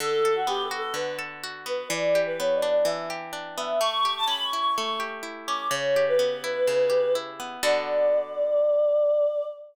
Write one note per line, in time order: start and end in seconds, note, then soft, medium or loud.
0.00 0.93 D3 loud
0.00 0.33 A4 loud
0.25 1.18 A4 medium
0.36 0.47 F#4 medium
0.47 1.65 B3 medium
0.47 0.62 G4 medium
0.64 0.78 A4 medium
0.71 1.43 F#4 loud
0.78 0.93 A4 medium
0.94 1.84 D3 medium
0.94 1.18 B4 medium
1.19 1.87 A4 medium
1.44 1.89 F#4 medium
1.66 1.89 B3 medium
1.66 1.91 B4 medium
1.89 2.84 E3 loud
1.89 2.18 D5 loud
2.15 3.09 G4 medium
2.26 2.38 B4 medium
2.39 3.57 B3 medium
2.39 2.54 C#5 medium
2.55 2.69 D5 medium
2.62 3.32 D4 medium
2.70 2.85 D5 medium
2.85 3.75 E3 loud
2.85 3.05 E5 medium
3.10 3.78 G4 medium
3.33 3.78 D4 medium
3.57 3.80 B3 medium
3.57 3.79 E5 medium
3.80 4.77 A3 loud
3.80 4.13 C#6 loud
4.05 4.99 G4 medium
4.17 4.29 A5 medium
4.27 5.47 C#4 medium
4.27 4.44 B5 medium
4.44 4.59 C#6 medium
4.53 5.22 E4 medium
4.60 4.75 C#6 medium
4.76 5.68 A3 medium
4.76 4.99 C#6 medium
5.00 5.68 G4 medium
5.23 5.68 E4 medium
5.47 5.71 C#4 medium
5.47 5.67 D6 medium
5.71 6.67 C#3 loud
5.71 6.04 C#5 medium
5.96 6.89 G4 medium
6.08 7.13 B4 loud
6.19 7.39 B3 medium
6.44 7.15 E4 medium
6.67 7.58 C#3 medium
6.90 7.58 G4 medium
7.15 7.61 E4 medium
7.40 7.62 B3 medium
7.63 9.45 D3 loud
7.63 9.45 B3 loud
7.63 9.45 F#4 loud
7.63 9.45 A4 loud
7.63 9.45 D5 loud